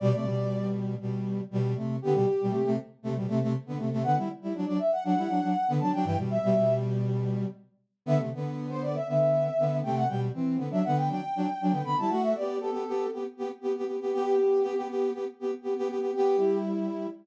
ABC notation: X:1
M:4/4
L:1/16
Q:1/4=119
K:G
V:1 name="Brass Section"
d d5 z10 | G G5 z10 | f z4 d e f f6 a g | g z e4 z10 |
e z4 c d e e6 g f | g z4 e f g g6 b a | f e d2 A4 z8 | G G5 z10 |
G4 z12 |]
V:2 name="Brass Section"
[B,,G,] [C,A,] [B,,G,]6 [B,,G,]4 [B,,G,]2 [C,A,]2 | [D,B,] [B,,G,] z [B,,G,] [C,A,] [C,A,] z2 [C,A,] [B,,G,] [C,A,] [C,A,] z [D,B,] [C,A,] [C,A,] | [D,B,] [G,E] z [G,E] [F,D] [F,D] z2 [F,D] [G,E] [F,D] [F,D] z [D,B,] [F,D] [F,D] | [G,,E,] [B,,G,]2 [B,,G,] [B,,G,]8 z4 |
[D,B,] [C,A,] [D,B,]6 [D,B,]4 [D,B,]2 [C,A,]2 | [B,,G,]2 [E,C]2 [D,B,] [F,D] [D,B,]2 [F,D] z [F,D] z [F,D] [D,B,] [D,B,] [G,E] | [A,F]2 [B,G]2 [B,G] [B,G] [B,G]2 [B,G] z [B,G] z [B,G] [B,G] [B,G] [B,G] | [B,G]2 [B,G]2 [B,G] [B,G] [B,G]2 [B,G] z [B,G] z [B,G] [B,G] [B,G] [B,G] |
[B,G]2 [G,E]6 z8 |]